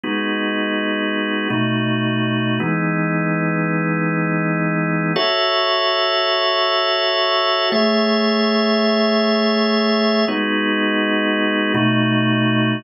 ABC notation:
X:1
M:7/8
L:1/8
Q:1/4=82
K:F#dor
V:1 name="Drawbar Organ"
[G,B,DF]4 [B,,A,DF]3 | [E,G,B,D]7 | [FAce]7 | [A,Gce]7 |
[G,B,DF]4 [B,,A,DF]3 |]